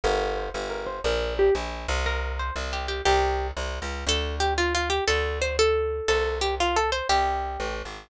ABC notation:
X:1
M:6/8
L:1/16
Q:3/8=119
K:Gdor
V:1 name="Pizzicato Strings"
B4 c2 z2 B2 c2 | B4 G2 z6 | B4 c2 z2 G2 G2 | G6 z6 |
[K:Ddor] A4 G2 F2 F2 G2 | A4 c2 A6 | A4 G2 F2 A2 c2 | G8 z4 |]
V:2 name="Electric Bass (finger)" clef=bass
G,,,6 G,,,6 | B,,,6 B,,,4 C,,2- | C,,6 C,,6 | C,,6 C,,3 _D,,3 |
[K:Ddor] D,,12 | D,,12 | C,,12 | C,,6 A,,,3 _A,,,3 |]